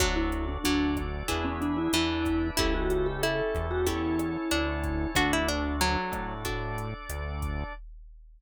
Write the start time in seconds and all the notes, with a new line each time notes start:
0.00 D2 F#3 D4 F#4 A4, kick, cross-stick, closed hi-hat
0.16 E4
0.32 closed hi-hat
0.48 D4
0.64 D2 F#3 D4 A4 D5, closed hi-hat
0.97 kick, cross-stick, closed hi-hat
1.28 E2 D4 E4 G#4 B4, kick, closed hi-hat
1.44 C#4
1.61 D4, closed hi-hat
1.77 E4
1.93 E2 E3 D4 E4 B4 D5, cross-stick, closed hi-hat
2.25 kick, closed hi-hat
2.57 C#2 C#4 E4 G4 A4, kick, closed hi-hat
2.74 F#4
2.90 F#4, closed hi-hat
3.06 G4
3.23 E4 A4, cross-stick, closed hi-hat
3.55 E2, kick, closed hi-hat
3.71 F#4
3.87 C#4 E4 G4 A4 C#5, kick, closed hi-hat
4.19 cross-stick, closed hi-hat
4.51 D2 D4, closed hi-hat
4.84 kick, closed hi-hat
5.15 D2 D4 F#4 A4, kick, cross-stick, closed hi-hat
5.33 E4
5.48 D4, closed hi-hat
5.81 F#3, closed hi-hat
6.12 A2, kick, cross-stick, closed hi-hat
6.45 D4 F#4 A4 D5, kick, closed hi-hat
6.78 closed hi-hat
7.09 D2, cross-stick, closed hi-hat
7.42 kick, closed hi-hat